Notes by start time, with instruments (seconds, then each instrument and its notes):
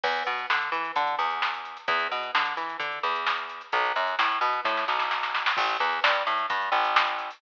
0.03 electric bass (finger) E2, kick, crash
0.16 closed hi-hat
0.26 electric bass (finger) B2, closed hi-hat
0.38 closed hi-hat
0.50 electric bass (finger) D3, snare
0.61 closed hi-hat
0.72 electric bass (finger) E3, closed hi-hat
0.84 closed hi-hat
0.95 electric bass (finger) D3, kick, closed hi-hat
1.07 closed hi-hat
1.19 electric bass (finger) E2, closed hi-hat
1.30 closed hi-hat
1.42 snare
1.54 closed hi-hat
1.65 closed hi-hat
1.77 closed hi-hat
1.88 electric bass (finger) E2, kick, closed hi-hat
1.99 closed hi-hat
2.11 electric bass (finger) B2, closed hi-hat
2.23 closed hi-hat
2.35 electric bass (finger) D3, snare
2.45 closed hi-hat
2.57 electric bass (finger) E3, closed hi-hat
2.69 closed hi-hat
2.80 electric bass (finger) D3, kick, closed hi-hat
2.92 closed hi-hat
3.03 electric bass (finger) E2, closed hi-hat
3.15 closed hi-hat
3.27 snare
3.38 closed hi-hat
3.49 closed hi-hat
3.61 closed hi-hat
3.72 electric bass (finger) B1, kick, closed hi-hat
3.85 closed hi-hat
3.95 electric bass (finger) F#2, closed hi-hat
4.07 closed hi-hat
4.19 electric bass (finger) A2, snare
4.31 closed hi-hat
4.41 electric bass (finger) B2, closed hi-hat
4.53 closed hi-hat
4.65 electric bass (finger) A2, kick, snare
4.77 snare
4.88 electric bass (finger) B1, snare
4.99 snare
5.11 snare
5.23 snare
5.34 snare
5.46 snare
5.57 electric bass (finger) A1, kick, crash
5.69 closed hi-hat
5.80 electric bass (finger) E2, closed hi-hat
5.92 closed hi-hat
6.04 electric bass (finger) G2, snare
6.14 closed hi-hat
6.27 electric bass (finger) A2, closed hi-hat
6.38 closed hi-hat
6.50 electric bass (finger) G2, kick, closed hi-hat
6.61 closed hi-hat
6.72 electric bass (finger) A1, closed hi-hat
6.84 closed hi-hat
6.96 snare
7.07 closed hi-hat
7.19 closed hi-hat
7.30 open hi-hat